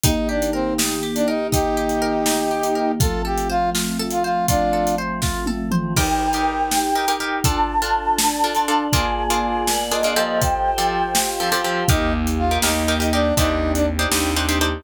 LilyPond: <<
  \new Staff \with { instrumentName = "Flute" } { \time 6/8 \key ees \lydian \tempo 4. = 81 r2. | r2. | r2. | r2. |
g''2. | a''2. | aes''2 ees''4 | g''2 r4 |
r2. | r2. | }
  \new Staff \with { instrumentName = "Brass Section" } { \time 6/8 \key ees \lydian ees'8 d'8 c'8 r8. d'16 ees'8 | <ees' g'>2. | a'8 g'8 f'8 r8. f'16 f'8 | <d' f'>4 r2 |
r2. | r2. | r2. | r2. |
ees'8 r8 f'8 ees'8. ees'16 d'8 | ees'8. d'16 r2 | }
  \new Staff \with { instrumentName = "Orchestral Harp" } { \time 6/8 \key ees \lydian ees'8 g'8 bes'8 ees'8 g'8 bes'8 | ees'8 g'8 bes'8 ees'8 g'8 bes'8 | f'8 a'8 c''8 f'8 a'8 c''8 | f'8 a'8 c''8 f'8 a'8 c''8 |
<ees' g' bes'>8. <ees' g' bes'>4~ <ees' g' bes'>16 <ees' g' bes'>16 <ees' g' bes'>16 <ees' g' bes'>8 | <d' f' a'>8. <d' f' a'>4~ <d' f' a'>16 <d' f' a'>16 <d' f' a'>16 <d' f' a'>8 | <bes d' f' aes'>8. <bes d' f' aes'>4~ <bes d' f' aes'>16 <bes d' f' aes'>16 <bes d' f' aes'>16 <f c' g' a'>8~ | <f c' g' a'>8. <f c' g' a'>4~ <f c' g' a'>16 <f c' g' a'>16 <f c' g' a'>16 <f c' g' a'>8 |
<ees' g' bes'>4~ <ees' g' bes'>16 <ees' g' bes'>16 <ees' g' bes'>8 <ees' g' bes'>16 <ees' g' bes'>16 <ees' g' bes'>8 | <d' ees' g' c''>4~ <d' ees' g' c''>16 <d' ees' g' c''>16 <d' ees' g' c''>8 <d' ees' g' c''>16 <d' ees' g' c''>16 <d' ees' g' c''>8 | }
  \new Staff \with { instrumentName = "Electric Bass (finger)" } { \clef bass \time 6/8 \key ees \lydian r2. | r2. | r2. | r2. |
r2. | r2. | r2. | r2. |
ees,4. ees,4. | ees,4. ees,4. | }
  \new Staff \with { instrumentName = "Choir Aahs" } { \time 6/8 \key ees \lydian <ees bes g'>2.~ | <ees bes g'>2. | <f a c'>2.~ | <f a c'>2. |
<ees' bes' g''>4. <ees' g' g''>4. | <d' f' a'>4. <d' a' d''>4. | <bes f' aes' d''>4. <bes f' bes' d''>4. | <f' g' a' c''>4. <f' g' c'' f''>4. |
<bes ees' g'>2. | <c' d' ees' g'>2. | }
  \new DrumStaff \with { instrumentName = "Drums" } \drummode { \time 6/8 <hh bd>8. hh8. sn8. hh8. | <hh bd>8. hh8. sn8. hh8. | <hh bd>8. hh8. sn8. hh8. | <hh bd>8. hh8. <bd sn>8 tommh8 toml8 |
<cymc bd>8. hh8. sn8. hh8. | <hh bd>8. hh8. sn8. hh8. | <hh bd>8. hh8. sn8. hh8. | <hh bd>8. hh8. sn8. hh8. |
<hh bd>8. hh8. sn8. hh8. | <hh bd>8. hh8. sn8. hh8. | }
>>